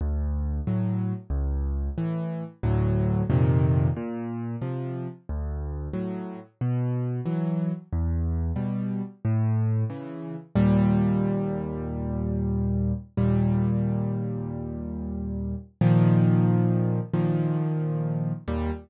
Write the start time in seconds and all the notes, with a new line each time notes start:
0.01 D2
0.67 A2 F#3
1.30 C#2
1.98 A2 E3
2.63 D2 A2 F#3
3.30 F2 A#2 C3 D#3
3.97 A#2
4.62 C3 F3
5.29 D2
5.93 A2 F#3
6.61 B2
7.26 E3 F#3
7.93 E2
8.56 B2 G3
9.25 A2
9.90 C#3 E3
10.55 D#2 A#2 G3
13.17 D#2 A#2 G3
15.81 A#2 D#3 F3
17.13 A#2 D#3 F3
18.48 D#2 A#2 G3